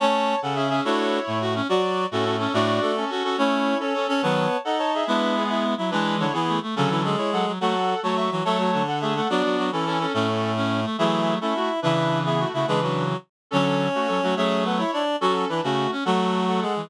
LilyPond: <<
  \new Staff \with { instrumentName = "Clarinet" } { \time 6/8 \key fis \minor \tempo 4. = 142 <cis'' a''>4. <a' fis''>8 <gis' e''>8 <gis' e''>8 | <e' cis''>2 r4 | <fis' d''>4. <cis' a'>8 <cis' a'>8 <cis' a'>8 | <fis' d''>4. <cis' a'>8 <cis' a'>8 <cis' a'>8 |
<e' cis''>4. <cis' a'>8 <cis' a'>8 <cis' a'>8 | <cis'' a''>4. <a' fis''>8 <cis'' a''>8 <gis' e''>8 | <d' b'>4 <b gis'>4 r4 | <d' b'>4 <e' cis''>8 <b gis'>4 r8 |
<cis' a'>4. <e' cis''>8 <a' fis''>8 r8 | <a' fis''>4. <cis'' a''>8 <e'' cis'''>8 r8 | <cis'' a''>4. <a' fis''>8 <gis' e''>8 <a' fis''>8 | <fis' d''>4. <cis' a'>8 <cis' a'>8 <cis' a'>8 |
<cis' a'>4. r4. | <gis' e''>4. <cis' a'>8 <a fis'>8 r8 | <d' b'>4. <b gis'>8 <a fis'>8 <a fis'>8 | <d' b'>8 <d' b'>4 r4. |
<cis' a'>4. <a fis'>8 <cis' a'>8 <a fis'>8 | <gis' e''>4 <a' fis''>8 <e' cis''>4 r8 | <cis' a'>4 <d' b'>8 <a fis'>4 r8 | <a' fis''>4. <a' fis''>4 r8 | }
  \new Staff \with { instrumentName = "Clarinet" } { \time 6/8 \key fis \minor <cis' cis''>4. <cis cis'>4. | <a a'>4. <a, a>4. | <fis fis'>4. <a, a>4. | <a, a>4 <a a'>4 r4 |
<cis' cis''>4. <cis' cis''>4 <cis' cis''>8 | <b b'>4. <dis' dis''>4. | <e' e''>4. <e' e''>4 <e' e''>8 | <e e'>4 <d d'>8 <e e'>4 r8 |
<cis cis'>8 <e e'>8 <gis gis'>2 | <fis fis'>4. <fis fis'>4 <fis fis'>8 | <a a'>8 <fis fis'>8 <d d'>2 | <fis fis'>8 <fis fis'>8 <fis fis'>8 <e e'>4. |
<a, a>2. | <e e'>4. <e' e''>4. | <e' e''>4. <e' e''>4 <e' e''>8 | <gis gis'>8 <fis fis'>4. r4 |
<cis' cis''>2. | <cis' cis''>4 <b b'>8 <e' e''>8 <d' d''>4 | <fis fis'>4 <e e'>8 <cis cis'>4 r8 | <fis fis'>2 <gis gis'>4 | }
  \new Staff \with { instrumentName = "Clarinet" } { \time 6/8 \key fis \minor <a cis'>4. r8 cis'8 cis'8 | <d' fis'>4. r8 fis'8 cis'8 | fis'8 r4 fis'4 cis'8 | <d' fis'>4. r8 fis'8 fis'8 |
<a cis'>4. r8 cis'8 cis'8 | <dis fis>4 r2 | <gis b>2~ <gis b>8 fis8 | <e gis>4. r8 a8 a8 |
<d fis>4. r8 fis8 fis8 | a8 r4 a4 e8 | <fis a>4. r8 a8 a8 | <b d'>4. r8 cis'8 cis'8 |
cis'8 r4 cis'4 a8 | <fis a>4. a8 r4 | <cis e>2~ <cis e>8 cis8 | <cis e>2 r4 |
<d fis>4. r8 fis8 fis8 | <fis a>2 r4 | fis'8 r4 fis'4 cis'8 | <fis a>2~ <fis a>8 e8 | }
>>